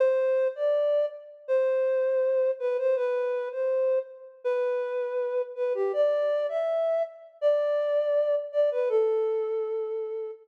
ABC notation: X:1
M:4/4
L:1/16
Q:1/4=81
K:Am
V:1 name="Flute"
c3 d3 z2 c6 B c | B3 c3 z2 B6 B G | d3 e3 z2 d6 d B | A8 z8 |]